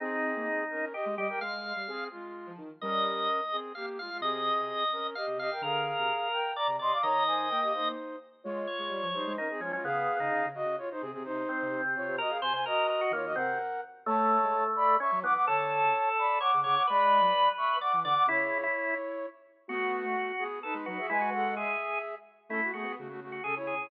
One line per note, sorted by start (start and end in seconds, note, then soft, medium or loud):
0.00 0.33 C4 medium
0.00 0.64 C4 medium
0.00 0.85 D#4 loud
0.00 0.64 G#4 loud
0.36 0.47 A#3 medium
0.70 0.93 C#4 medium
0.70 0.93 A#4 medium
0.92 1.15 G4 medium
0.92 1.05 G4 medium
0.92 1.15 D#5 medium
1.06 1.17 G#3 medium
1.16 1.29 G3 medium
1.16 1.28 G4 medium
1.16 1.39 G4 medium
1.16 1.28 D#5 medium
1.28 1.40 A#4 medium
1.28 1.40 G5 loud
1.41 1.72 G#3 medium
1.41 2.04 F5 medium
1.76 1.87 G3 medium
1.88 2.09 C4 medium
1.88 2.09 G#4 medium
2.11 2.52 G#3 medium
2.11 2.52 F4 medium
2.46 2.58 F3 medium
2.58 2.69 D#3 medium
2.81 3.27 G3 medium
2.81 3.41 C#4 medium
2.81 3.41 A#4 loud
2.81 3.57 D#5 loud
3.52 3.72 C4 medium
3.52 3.72 G#4 medium
3.75 3.98 A#3 medium
3.75 3.98 G4 medium
3.75 3.86 F5 medium
3.99 4.10 G#3 medium
3.99 4.10 F4 medium
3.99 4.18 F5 medium
4.10 4.21 G#3 medium
4.10 4.21 F4 medium
4.21 4.49 C3 medium
4.21 4.84 C4 medium
4.21 4.84 G#4 loud
4.21 5.07 D#5 medium
4.59 4.70 C3 medium
4.92 5.15 C#4 medium
4.92 5.15 A#4 medium
5.15 5.38 G4 medium
5.15 5.38 D#5 medium
5.15 5.26 F5 medium
5.27 5.36 C3 medium
5.37 5.48 C3 medium
5.37 5.50 G4 medium
5.37 5.50 D#5 medium
5.37 5.62 F5 medium
5.51 5.62 A#4 medium
5.51 5.62 G5 medium
5.61 5.92 D3 medium
5.61 6.28 G#4 medium
5.61 6.52 A#4 loud
5.61 6.28 F5 loud
5.98 6.10 C3 medium
6.33 6.54 A#4 medium
6.33 6.54 G5 medium
6.56 6.67 D5 loud
6.56 6.76 D5 medium
6.56 6.76 A#5 medium
6.67 6.78 C3 medium
6.79 6.91 C3 medium
6.79 6.98 D5 medium
6.79 6.92 D#5 medium
6.79 6.92 C6 medium
6.92 7.03 F5 medium
6.92 7.03 D6 medium
7.02 7.47 D#3 medium
7.02 7.23 C#5 medium
7.02 7.88 D#5 loud
7.02 7.23 A#5 loud
7.27 7.49 C5 medium
7.27 7.49 G#5 medium
7.49 7.93 A#3 medium
7.49 7.60 A#4 medium
7.49 7.60 G5 medium
7.62 7.73 G4 medium
7.62 7.73 D#5 medium
7.73 8.16 D#4 medium
7.73 8.16 C5 medium
8.44 8.66 G#3 medium
8.44 9.07 F4 medium
8.44 9.07 C#5 medium
8.67 9.33 C#5 medium
8.79 8.90 G#3 medium
8.89 9.00 G3 medium
9.02 9.13 F3 medium
9.13 9.25 G3 medium
9.13 9.36 D#4 medium
9.13 9.36 C5 medium
9.27 9.38 G#3 medium
9.37 9.48 C#4 medium
9.37 9.60 D#4 medium
9.37 9.48 A#4 medium
9.50 9.61 C4 medium
9.50 9.61 G#4 medium
9.60 9.71 F3 medium
9.60 9.72 G#3 medium
9.60 9.72 C#4 loud
9.60 9.72 F4 medium
9.71 9.82 F#3 medium
9.71 9.84 G#3 medium
9.71 9.84 C#4 loud
9.71 9.84 F4 medium
9.84 10.06 C#3 medium
9.84 10.16 B3 loud
9.84 10.46 G#4 loud
9.84 10.46 F5 loud
10.19 10.30 C#3 medium
10.19 10.48 D#4 medium
10.30 10.41 C#3 medium
10.42 10.53 C#3 medium
10.55 10.64 C#3 medium
10.55 10.76 F#4 medium
10.55 10.76 D#5 loud
10.65 10.76 C#3 medium
10.78 10.89 F4 medium
10.78 10.89 C#5 loud
10.91 11.02 D#4 medium
10.91 11.02 C5 loud
11.00 11.13 C3 medium
11.00 11.11 C4 medium
11.00 11.11 G#4 loud
11.12 11.23 C3 medium
11.12 11.23 C4 medium
11.12 11.23 G#4 medium
11.23 11.43 C3 medium
11.23 11.81 D#4 loud
11.23 11.81 C5 loud
11.49 12.16 C4 loud
11.62 11.71 C3 medium
11.71 11.82 C3 medium
11.84 11.95 C3 medium
11.95 12.06 C3 medium
11.95 12.16 F4 medium
11.95 12.16 C#5 medium
12.08 12.19 C3 medium
12.18 12.31 F#4 medium
12.18 12.37 A#4 loud
12.18 12.31 D#5 loud
12.29 12.40 G#4 medium
12.29 12.40 F5 loud
12.42 12.52 C3 medium
12.42 12.53 C5 loud
12.42 12.53 C5 medium
12.42 12.53 G#5 medium
12.53 12.64 C3 medium
12.53 12.65 C5 loud
12.53 12.65 C5 medium
12.53 12.65 G#5 loud
12.66 13.12 F#4 loud
12.66 12.87 A#4 loud
12.66 13.12 D#5 loud
12.89 13.00 A#4 loud
13.01 13.12 F#4 medium
13.11 13.32 D#3 medium
13.11 13.33 A#3 medium
13.11 13.25 F4 medium
13.11 13.25 C#5 medium
13.25 13.36 F#4 medium
13.25 13.36 D#5 medium
13.35 13.56 C3 medium
13.35 13.58 C4 loud
13.35 13.81 A#4 medium
13.35 13.81 F#5 loud
14.06 14.97 A3 loud
14.06 14.38 A3 medium
14.06 14.64 C#5 medium
14.06 14.64 A5 loud
14.43 14.54 G#3 medium
14.76 14.95 D5 medium
14.76 14.95 B5 loud
15.00 15.11 C#4 loud
15.00 15.20 E5 medium
15.00 15.20 C#6 loud
15.12 15.23 F#3 medium
15.22 15.33 E3 medium
15.22 15.46 B3 loud
15.22 15.34 F#5 medium
15.22 15.34 D6 loud
15.34 15.46 F#5 medium
15.34 15.46 D6 loud
15.46 15.82 D3 medium
15.46 16.39 A4 loud
15.46 16.09 C#5 medium
15.46 16.09 A5 loud
15.82 15.93 C#3 medium
16.18 16.38 D5 medium
16.18 16.38 B5 medium
16.40 16.51 C#5 medium
16.40 16.60 F#5 medium
16.40 16.60 D6 medium
16.54 16.65 C#3 medium
16.64 16.77 C#3 medium
16.64 16.83 C#5 loud
16.64 16.75 F#5 medium
16.64 16.75 D6 medium
16.75 16.87 F#5 medium
16.75 16.87 D6 medium
16.87 17.20 G#3 medium
16.87 17.76 B4 loud
16.87 17.49 D5 loud
16.87 17.49 B5 loud
17.21 17.32 F#3 medium
17.57 17.78 E5 medium
17.57 17.78 C#6 medium
17.81 17.92 D5 medium
17.81 18.00 F#5 medium
17.81 18.00 D6 medium
17.93 18.04 E3 medium
18.04 18.15 D3 medium
18.04 18.24 D5 loud
18.04 18.15 F#5 loud
18.04 18.15 D6 loud
18.15 18.26 F#5 loud
18.15 18.26 D6 loud
18.27 18.66 C#3 medium
18.27 18.58 E4 loud
18.27 19.26 E4 medium
18.27 19.26 C#5 loud
18.63 18.94 E4 loud
19.68 20.32 A3 loud
19.68 20.02 B3 medium
19.68 20.32 F#4 loud
19.68 20.44 F#4 loud
20.04 20.15 A3 medium
20.38 20.59 B3 loud
20.38 20.59 G#4 loud
20.63 20.86 D#4 medium
20.63 20.74 A4 loud
20.63 20.86 B4 loud
20.74 20.85 G#3 medium
20.86 20.98 F#3 medium
20.86 20.98 D#4 medium
20.86 21.07 F#4 medium
20.86 20.98 B4 medium
20.98 21.09 G#4 medium
20.98 21.09 E5 medium
21.09 21.76 G#3 medium
21.09 21.21 E4 loud
21.09 21.30 B4 loud
21.09 21.30 G#5 loud
21.21 21.54 F#4 loud
21.33 21.55 A4 medium
21.33 21.55 F#5 loud
21.56 22.15 G#4 medium
21.56 21.99 G#4 medium
21.56 22.15 E5 medium
22.49 22.60 A3 medium
22.49 22.61 C#4 medium
22.49 22.71 E4 medium
22.49 22.61 A4 loud
22.62 22.73 A3 medium
22.62 22.73 F#4 loud
22.73 22.84 A3 medium
22.73 22.95 B3 medium
22.73 22.92 F#4 medium
22.73 22.95 G#4 medium
22.83 22.94 B3 medium
22.97 23.38 C#3 medium
22.97 23.08 A3 medium
22.97 23.08 F#4 medium
23.09 23.20 A3 medium
23.09 23.20 F#4 loud
23.21 23.41 A3 medium
23.21 23.41 F#4 medium
23.32 23.43 F#4 medium
23.44 23.59 C#3 medium
23.44 23.55 C#4 medium
23.44 23.55 G#4 medium
23.44 23.55 A4 medium
23.55 23.75 E4 medium
23.55 23.75 C#5 medium
23.62 23.73 C#3 medium
23.67 23.87 G#4 medium
23.73 23.88 C#3 medium
23.79 23.90 E4 medium
23.79 23.90 C#5 medium